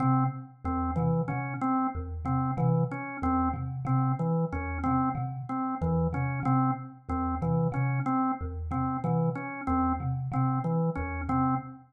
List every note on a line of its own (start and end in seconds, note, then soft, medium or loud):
0.00 0.25 C3 medium
0.00 0.24 C4 medium
0.65 0.90 E2 medium
0.65 0.91 C4 medium
0.96 1.23 C3 medium
0.96 1.22 E3 medium
1.28 1.55 C3 medium
1.28 1.54 C#4 medium
1.61 1.87 C4 medium
1.95 2.21 E2 medium
2.25 2.51 C3 medium
2.25 2.51 C4 medium
2.57 2.83 C3 medium
2.57 2.83 E3 medium
2.91 3.17 C#4 medium
3.22 3.48 E2 medium
3.22 3.49 C4 medium
3.53 3.79 C3 medium
3.85 4.11 C3 medium
3.85 4.12 C4 medium
4.19 4.45 E3 medium
4.52 4.78 E2 medium
4.52 4.78 C#4 medium
4.84 5.12 C3 medium
4.84 5.09 C4 medium
5.15 5.41 C3 medium
5.49 5.75 C4 medium
5.81 6.07 E2 medium
5.81 6.07 E3 medium
6.13 6.39 C3 medium
6.13 6.40 C#4 medium
6.43 6.69 C3 medium
6.43 6.71 C4 medium
7.09 7.35 E2 medium
7.09 7.35 C4 medium
7.42 7.67 C3 medium
7.42 7.68 E3 medium
7.72 7.98 C3 medium
7.72 7.99 C#4 medium
8.06 8.32 C4 medium
8.41 8.67 E2 medium
8.71 8.97 C3 medium
8.71 8.97 C4 medium
9.04 9.30 C3 medium
9.04 9.30 E3 medium
9.35 9.61 C#4 medium
9.67 9.94 E2 medium
9.67 9.93 C4 medium
10.00 10.26 C3 medium
10.32 10.58 C3 medium
10.32 10.59 C4 medium
10.64 10.90 E3 medium
10.95 11.23 E2 medium
10.95 11.21 C#4 medium
11.29 11.54 C3 medium
11.29 11.55 C4 medium